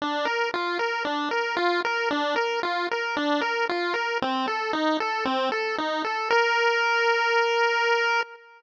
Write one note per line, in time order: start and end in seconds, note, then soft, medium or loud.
0.02 0.26 D4 medium
0.25 0.49 A#4 medium
0.54 0.78 F4 medium
0.79 1.03 A#4 medium
1.05 1.29 D4 medium
1.31 1.55 A#4 medium
1.57 1.81 F4 medium
1.85 2.09 A#4 medium
2.11 2.35 D4 medium
2.36 2.60 A#4 medium
2.63 2.87 F4 medium
2.91 3.16 A#4 medium
3.17 3.41 D4 medium
3.41 3.66 A#4 medium
3.69 3.94 F4 medium
3.94 4.18 A#4 medium
4.22 4.46 C4 medium
4.48 4.72 A4 medium
4.73 4.97 D#4 medium
5.00 5.24 A4 medium
5.25 5.50 C4 medium
5.52 5.76 A4 medium
5.78 6.03 D#4 medium
6.04 6.29 A4 medium
6.30 8.21 A#4 loud